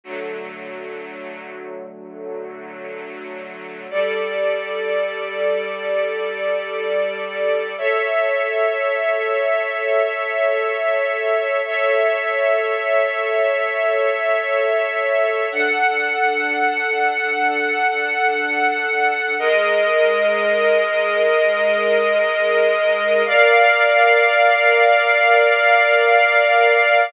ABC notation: X:1
M:3/4
L:1/8
Q:1/4=93
K:Glyd
V:1 name="String Ensemble 1"
[D,F,A,]6- | [D,F,A,]6 | [G,Ad]6- | [G,Ad]6 |
[Ace]6- | [Ace]6 | [Ace]6- | [Ace]6 |
[DAf]6- | [DAf]6 | [K:Ablyd] [A,Be]6- | [A,Be]6 |
[Bdf]6- | [Bdf]6 |]